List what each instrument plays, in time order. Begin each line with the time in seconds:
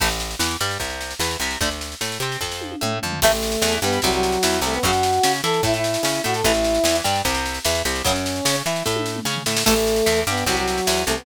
0.00 electric bass (finger) A1, acoustic guitar (steel) E3 A3, kick, snare, crash
0.10 snare
0.20 snare
0.31 snare
0.39 electric bass (finger) E2, acoustic guitar (steel) E3, snare
0.51 snare
0.60 electric bass (finger) G2, acoustic guitar (steel) G3, snare
0.71 snare
0.80 electric bass (finger) C2, acoustic guitar (steel) C3, kick, snare
0.90 snare
1.01 snare
1.11 snare
1.19 electric bass (finger) E2, acoustic guitar (steel) E3, snare
1.31 snare
1.40 electric bass (finger) C2, acoustic guitar (steel) C3, snare
1.51 snare
1.61 electric bass (finger) D2, acoustic guitar (steel) D3 A3, kick, snare
1.71 snare
1.81 snare
1.92 snare
2.01 electric bass (finger) A2, acoustic guitar (steel) A3, snare
2.12 snare
2.20 electric bass (finger) C3, acoustic guitar (steel) C4, snare
2.32 snare
2.41 electric bass (finger) F2, acoustic guitar (steel) F3, kick, snare
2.52 snare
2.61 high tom
2.72 high tom
2.81 electric bass (finger) A2, acoustic guitar (steel) A3, mid tom
3.02 electric bass (finger) F2, acoustic guitar (steel) F3, floor tom
3.12 floor tom
3.21 electric bass (finger) A1, acoustic guitar (steel) E3 A3, brass section A3 A4, kick, snare, crash
3.32 snare
3.43 snare
3.52 snare
3.62 electric bass (finger) E2, acoustic guitar (steel) E3, snare
3.72 snare
3.82 electric bass (finger) G2, acoustic guitar (steel) G3, brass section B3 B4, snare
3.92 snare
4.02 electric bass (finger) C2, acoustic guitar (steel) C3, brass section F#3 F#4, kick, snare
4.12 brass section F#3 F#4, snare
4.23 snare
4.32 snare
4.43 electric bass (finger) E2, acoustic guitar (steel) E3, snare
4.53 snare
4.61 electric bass (finger) C2, acoustic guitar (steel) C3, brass section A3 A4, snare
4.73 brass section B3 B4, snare
4.83 electric bass (finger) F#2, acoustic guitar (steel) C#3 F#3, brass section F#4 F#5, kick, snare
4.93 snare
5.03 snare
5.13 snare
5.23 electric bass (finger) C#3, acoustic guitar (steel) C#4, snare
5.34 snare
5.43 electric bass (finger) E3, acoustic guitar (steel) E4, brass section A4 A5, snare
5.54 snare
5.63 electric bass (finger) A2, acoustic guitar (steel) A3, brass section E4 E5, kick, snare
5.74 brass section E4 E5, snare
5.84 snare
5.94 snare
6.03 electric bass (finger) C#3, acoustic guitar (steel) C#4, snare
6.15 snare
6.24 electric bass (finger) A2, acoustic guitar (steel) A3, brass section F#4 F#5, snare
6.34 brass section A4 A5, snare
6.44 electric bass (finger) A1, acoustic guitar (steel) E3 A3, brass section E4 E5, kick, snare
6.54 snare
6.64 snare
6.74 snare
6.84 electric bass (finger) E2, acoustic guitar (steel) E3, snare
6.95 snare
7.04 electric bass (finger) G2, acoustic guitar (steel) G3, snare
7.15 snare
7.25 electric bass (finger) C2, acoustic guitar (steel) C3, kick, snare
7.35 snare
7.46 snare
7.54 snare
7.65 electric bass (finger) E2, acoustic guitar (steel) E3, snare
7.75 snare
7.85 electric bass (finger) C2, acoustic guitar (steel) C3, snare
7.95 snare
8.04 electric bass (finger) F#2, acoustic guitar (steel) C#3 F#3, brass section C#4 C#5, kick, snare
8.16 snare
8.26 snare
8.36 snare
8.45 electric bass (finger) C#3, acoustic guitar (steel) C#4, snare
8.55 snare
8.66 electric bass (finger) E3, acoustic guitar (steel) E4, snare
8.76 snare
8.86 electric bass (finger) A2, acoustic guitar (steel) A3, kick, snare
8.96 high tom
9.06 snare
9.16 mid tom
9.25 electric bass (finger) C#3, acoustic guitar (steel) C#4, snare
9.36 floor tom
9.46 electric bass (finger) A2, acoustic guitar (steel) A3, snare
9.57 snare
9.66 electric bass (finger) A1, acoustic guitar (steel) E3 A3, brass section A3 A4, kick, snare, crash
9.76 snare
9.87 snare
9.96 snare
10.06 electric bass (finger) E2, acoustic guitar (steel) E3, snare
10.16 snare
10.27 electric bass (finger) G2, acoustic guitar (steel) G3, brass section B3 B4, snare
10.37 snare
10.46 electric bass (finger) C2, acoustic guitar (steel) C3, brass section F#3 F#4, kick, snare
10.57 brass section F#3 F#4, snare
10.68 snare
10.78 snare
10.87 electric bass (finger) E2, acoustic guitar (steel) E3, snare
10.97 snare
11.05 electric bass (finger) C2, acoustic guitar (steel) C3, brass section A3 A4, snare
11.16 brass section B3 B4, snare